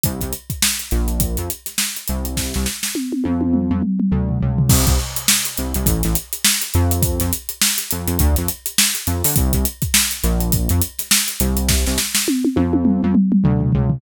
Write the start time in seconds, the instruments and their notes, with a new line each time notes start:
0.04 synth bass 1 C2, kick, closed hi-hat
0.21 synth bass 1 C2, kick, closed hi-hat
0.33 closed hi-hat
0.50 kick, closed hi-hat
0.62 snare
0.79 closed hi-hat
0.91 synth bass 1 A#1, snare, closed hi-hat
1.08 closed hi-hat
1.20 kick, closed hi-hat
1.37 synth bass 1 F2, closed hi-hat
1.50 closed hi-hat
1.66 snare, closed hi-hat
1.78 snare
1.96 closed hi-hat
2.08 synth bass 1 C2, closed hi-hat
2.25 closed hi-hat
2.37 kick, snare
2.54 synth bass 1 C2, snare
2.66 snare
2.83 snare
2.95 high tom
3.12 high tom
3.24 synth bass 1 F2, high tom
3.41 high tom
3.54 mid tom
3.71 synth bass 1 F2, mid tom
3.83 mid tom
4.00 mid tom
4.12 synth bass 1 D2, floor tom
4.29 floor tom
4.41 synth bass 1 C#2, floor tom
4.58 floor tom
4.69 synth bass 1 C2, kick, crash
4.87 synth bass 1 C2, kick, closed hi-hat
4.99 snare
5.17 closed hi-hat
5.28 snare
5.45 closed hi-hat
5.58 synth bass 1 C2, closed hi-hat
5.74 synth bass 1 C2, closed hi-hat
5.86 synth bass 1 A1, kick, closed hi-hat
6.03 synth bass 1 A1, snare, closed hi-hat
6.15 closed hi-hat
6.33 closed hi-hat
6.45 snare
6.62 snare, closed hi-hat
6.74 synth bass 1 F2, closed hi-hat
6.91 closed hi-hat
7.03 kick, closed hi-hat
7.20 synth bass 1 F2, snare, closed hi-hat
7.33 closed hi-hat
7.49 closed hi-hat
7.62 snare
7.78 closed hi-hat
7.91 synth bass 1 F2, closed hi-hat
8.08 synth bass 1 F2, closed hi-hat
8.19 synth bass 1 D2, kick, closed hi-hat
8.36 synth bass 1 F2, snare, closed hi-hat
8.48 closed hi-hat
8.66 closed hi-hat
8.78 snare
8.95 snare, closed hi-hat
9.07 synth bass 1 F2, closed hi-hat
9.24 synth bass 1 D3, snare, open hi-hat
9.36 synth bass 1 C2, kick, closed hi-hat
9.53 synth bass 1 C2, kick, closed hi-hat
9.65 closed hi-hat
9.82 kick, closed hi-hat
9.94 snare
10.11 closed hi-hat
10.23 synth bass 1 A#1, snare, closed hi-hat
10.41 closed hi-hat
10.52 kick, closed hi-hat
10.69 synth bass 1 F2, closed hi-hat
10.82 closed hi-hat
10.99 snare, closed hi-hat
11.11 snare
11.28 closed hi-hat
11.40 synth bass 1 C2, closed hi-hat
11.57 closed hi-hat
11.69 kick, snare
11.87 synth bass 1 C2, snare
11.98 snare
12.15 snare
12.28 high tom
12.45 high tom
12.56 synth bass 1 F2, high tom
12.73 high tom
12.85 mid tom
13.03 synth bass 1 F2, mid tom
13.15 mid tom
13.32 mid tom
13.44 synth bass 1 D2, floor tom
13.61 floor tom
13.72 synth bass 1 C#2, floor tom
13.90 floor tom